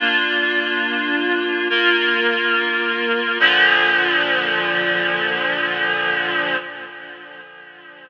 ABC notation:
X:1
M:3/4
L:1/8
Q:1/4=53
K:Bb
V:1 name="Clarinet"
[B,DF]3 [B,FB]3 | [B,,D,F,]6 |]